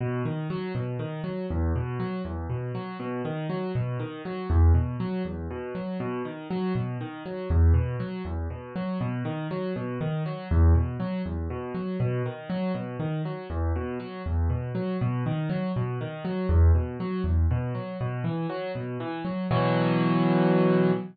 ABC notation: X:1
M:6/8
L:1/8
Q:3/8=80
K:B
V:1 name="Acoustic Grand Piano" clef=bass
B,, D, F, B,, D, F, | E,, B,, F, E,, B,, F, | B,, D, F, B,, D, F, | E,, B,, F, E,, B,, F, |
B,, D, F, B,, D, F, | E,, B,, F, E,, B,, F, | B,, D, F, B,, D, F, | E,, B,, F, E,, B,, F, |
B,, D, F, B,, D, F, | E,, B,, F, E,, B,, F, | B,, D, F, B,, D, F, | E,, B,, F, E,, B,, F, |
B,, E, F, B,, E, F, | [B,,E,F,]6 |]